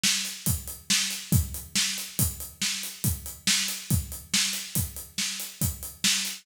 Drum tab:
HH |-xxx-x|xx-xxx-xxx-x|xx-xxx-xxx-x|
SD |o---o-|--o---o---o-|--o---o---o-|
BD |--o---|o---o---o---|o---o---o---|